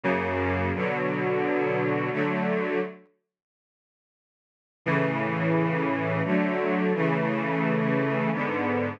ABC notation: X:1
M:3/4
L:1/8
Q:1/4=87
K:A
V:1 name="String Ensemble 1"
[F,,C,^A,]2 | [B,,D,F,]4 [D,F,A,]2 | z6 | [A,,C,E,]4 [D,F,A,]2 |
[C,E,A,]4 [G,,D,B,]2 |]